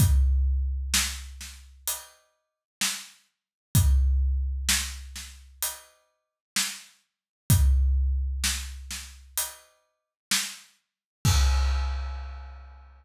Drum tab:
CC |--------|--------|--------|x-------|
HH |x---x---|x---x---|x---x---|--------|
SD |--oo--o-|--oo--o-|--oo--o-|--------|
BD |o-------|o-------|o-------|o-------|